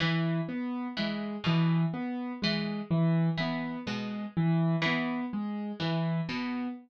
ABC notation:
X:1
M:7/8
L:1/8
Q:1/4=62
K:none
V:1 name="Harpsichord" clef=bass
E, z E, B,, z E, z | E, B,, z E, z E, B,, |]
V:2 name="Acoustic Grand Piano"
E, B, ^G, E, B, G, E, | B, ^G, E, B, G, E, B, |]